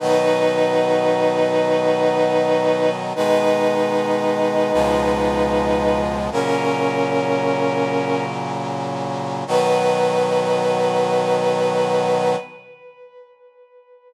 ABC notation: X:1
M:4/4
L:1/8
Q:1/4=76
K:B
V:1 name="Brass Section"
[DB]8 | [DB]8 | [CA]6 z2 | B8 |]
V:2 name="Brass Section" clef=bass
[B,,D,F,]8 | [B,,D,G,]4 [C,,B,,^E,G,]4 | [A,,C,F,]8 | [B,,D,F,]8 |]